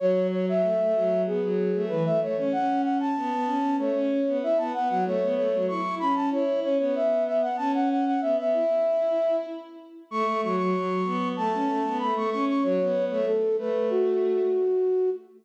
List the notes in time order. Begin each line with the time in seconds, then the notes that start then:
0.00 F#3 C#5
0.31 C#5
0.49 E5
0.62 A3
0.80 A3
0.95 F#3
1.26 B3 G#4
1.43 F#3
1.74 A3
1.88 E3 B4
2.05 A3 E5
2.20 A3 C#5
2.37 C#4 C#5
2.52 C#4 F#5
2.83 F#5
3.00 A5
3.16 B3
3.32 B3
3.46 C#4
3.78 A3 C#5
3.94 C#4
4.26 B3
4.42 E4 E5
4.58 B3 A5
4.74 B3 F#5
4.89 F#3 F#5
5.05 A3 C#5
5.22 B3
5.35 A3 C#5
5.53 F#3
5.68 E4 C#6
5.99 C#4 B5
6.15 A5
6.31 E4 C#5
6.63 C#4 C#5
6.79 B3 C#5
6.95 E5
7.26 E5
7.41 F#5
7.57 C#4 A5
7.74 F#5
7.90 F#5
8.06 F#5
8.21 B3 E5
8.37 B3 E5
8.53 E4
10.10 A3 C#6
10.25 A3
10.43 F#3 C#6
10.57 F#3 C#6
10.75 F#3
11.05 B3
11.37 A3 A5
11.53 C#4
11.68 A3
11.85 B3
11.99 A3 B5
12.15 A3 C#6
12.30 C#4 C#6
12.48 C#6
12.63 F#3 C#5
12.80 B3
13.10 A3 C#5
13.26 A4
13.57 A3 B4
13.90 F#4